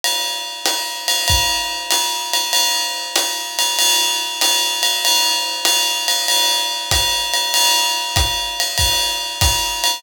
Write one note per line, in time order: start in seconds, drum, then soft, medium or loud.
0.04 ride medium
0.66 hi-hat pedal medium
0.66 ride medium
1.08 ride medium
1.28 kick medium
1.28 ride medium
1.91 hi-hat pedal medium
1.91 ride medium
2.33 ride medium
2.53 ride medium
3.16 hi-hat pedal medium
3.16 ride medium
3.59 ride medium
3.79 ride loud
4.41 hi-hat pedal medium
4.41 ride medium
4.83 ride medium
5.05 ride loud
5.65 hi-hat pedal medium
5.65 ride medium
6.08 ride medium
6.28 ride medium
6.91 kick medium
6.91 hi-hat pedal medium
6.91 ride medium
7.34 ride medium
7.54 ride loud
8.16 kick medium
8.16 hi-hat pedal medium
8.16 ride medium
8.60 ride medium
8.78 kick medium
8.78 ride medium
9.41 kick medium
9.41 hi-hat pedal medium
9.41 ride medium
9.84 ride medium